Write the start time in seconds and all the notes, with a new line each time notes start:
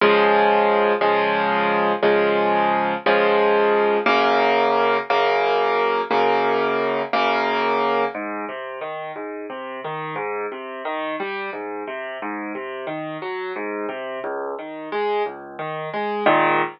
0.01 C#3 F3 G#3
1.01 C#3 F3 G#3
2.03 C#3 F3 G#3
3.06 C#3 F3 G#3
4.06 F#2 C#3 A#3
5.10 F#2 C#3 A#3
6.11 F#2 C#3 A#3
7.13 F#2 C#3 A#3
8.15 G#2
8.49 C3
8.81 D#3
9.16 G#2
9.50 C3
9.84 D#3
10.16 G#2
10.52 C3
10.85 D#3
11.20 G3
11.53 G#2
11.87 C3
12.22 G#2
12.55 C3
12.87 D#3
13.22 F#3
13.56 G#2
13.89 C3
14.24 C#2
14.59 D#3
14.92 G#3
15.26 C#2
15.59 D#3
15.94 G#3
16.26 G#2 A#2 D#3